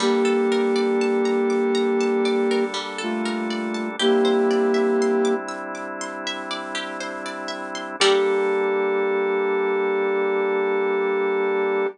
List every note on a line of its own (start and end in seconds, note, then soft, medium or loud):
0.00 3.96 G3 medium
0.00 0.23 G3 medium
0.00 2.65 A#3 loud
0.00 3.96 A#3 medium
0.00 3.96 D4 medium
0.00 2.65 G4 loud
0.00 3.96 A4 medium
0.25 0.47 A4 medium
0.52 0.74 A#4 medium
0.76 0.98 D5 medium
1.01 1.24 A5 medium
1.25 1.48 A#5 medium
1.50 1.72 D6 medium
1.75 1.97 A#5 medium
2.01 2.23 A5 medium
2.25 2.48 D5 medium
2.51 2.74 A#4 medium
2.74 2.96 G3 medium
2.98 3.89 A3 medium
2.98 3.89 F4 medium
2.98 3.21 A4 medium
3.25 3.48 A#4 medium
3.50 3.73 D5 medium
3.74 3.97 A5 medium
3.99 7.96 G3 medium
3.99 5.35 A#3 loud
3.99 7.96 C4 medium
3.99 7.96 D4 medium
3.99 7.96 E4 medium
3.99 4.22 G4 medium
3.99 5.35 G4 loud
4.25 4.47 C5 medium
4.51 4.73 D5 medium
4.74 4.97 E5 medium
5.02 5.24 C6 medium
5.25 5.47 D6 medium
5.49 5.71 E6 medium
5.75 5.97 D6 medium
6.01 6.24 C6 medium
6.27 6.49 E5 medium
6.51 6.73 D5 medium
6.75 6.97 G4 medium
7.00 7.23 C5 medium
7.26 7.48 D5 medium
7.48 7.71 E5 medium
7.75 7.97 C6 medium
8.00 11.87 G3 medium
8.00 11.88 G3 loud
8.00 11.87 A#3 medium
8.00 11.87 D4 medium
8.00 11.88 G4 loud
8.00 11.87 A4 loud
8.00 11.88 A4 loud
8.00 11.88 A#4 medium
8.00 11.88 D5 loud